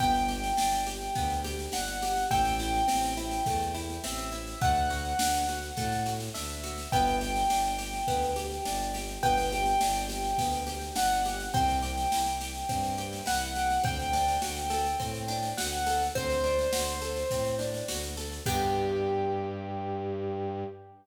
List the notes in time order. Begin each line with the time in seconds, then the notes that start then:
0.00 G1 B3 G5, kick, snare
0.14 snare
0.28 G4, snare
0.44 snare
0.57 G1 D4, snare
0.73 snare
0.87 G4, snare
1.01 snare
1.15 D2 B3, kick, snare
1.30 snare
1.44 G4, snare
1.59 snare
1.72 G1 D4 F#5, snare
1.87 snare
2.02 G4, snare
2.16 snare
2.30 A1 A3 G5, kick, snare
2.45 snare
2.59 E4, snare
2.74 snare
2.88 A1 C4, snare
3.03 snare
3.17 E4, snare
3.31 snare
3.46 E2 A3, kick, snare
3.60 snare
3.75 E4, snare
3.90 snare
4.03 A1 C4 E5, snare
4.19 snare
4.32 E4, snare
4.47 snare
4.61 D2 A3 F#5, kick, snare
4.75 snare
4.90 F#4, snare
5.05 snare
5.19 D2 D4, snare
5.34 snare
5.48 F#4, snare
5.63 snare
5.77 A2 A3, kick, snare
5.92 snare
6.06 F#4, snare
6.20 snare
6.34 D2 D4 E5, snare
6.50 snare
6.63 F#4, snare
6.78 snare
6.92 G1 B3 G5, kick, snare
7.07 snare
7.21 G4, snare
7.36 snare
7.50 G1 D4, snare
7.64 snare
7.78 G4, snare
7.94 snare
8.07 D2 B3, kick, snare
8.22 snare
8.36 G4, snare
8.51 snare
8.65 G1 D4, snare
8.80 snare
8.94 G4, snare
9.08 snare
9.23 G1 B3 G5, kick, snare
9.38 snare
9.52 G4, snare
9.66 snare
9.81 G1 D4, snare
9.96 snare
10.09 G4, snare
10.24 snare
10.38 D2 B3, kick, snare
10.53 snare
10.67 G4, snare
10.81 snare
10.95 G1 D4 F#5, snare
11.10 snare
11.25 G4, snare
11.40 snare
11.54 C2 C4 G5, kick, snare
11.68 snare
11.82 G4, snare
11.97 snare
12.12 C2 E4, snare
12.26 snare
12.41 G4, snare
12.54 snare
12.69 G2 C4, kick, snare
12.83 snare
12.98 G4, snare
13.13 snare
13.26 C2 E4 F#5, snare
13.41 snare
13.55 G4, snare
13.70 snare
13.84 D2 C4 G5, kick, snare
14.00 snare
14.13 D4, snare
14.28 snare
14.42 D2 F#4, snare
14.56 snare
14.70 A4, snare
14.86 snare
15.00 A2 C4, kick, snare
15.14 snare
15.28 D4, snare
15.43 snare
15.57 D2 F#4 F#5, snare
15.72 snare
15.86 A4, snare
16.02 snare
16.15 D2 C4 C5, kick, snare
16.30 snare
16.44 D4, snare
16.59 snare
16.72 D2 F#4, snare
16.87 snare
17.02 A4, snare
17.16 snare
17.30 A2 C4, kick, snare
17.45 snare
17.59 D4, snare
17.74 snare
17.88 D2 F#4, snare
18.03 snare
18.17 A4, snare
18.32 snare
18.46 G2 B3 D4 G4, kick, crash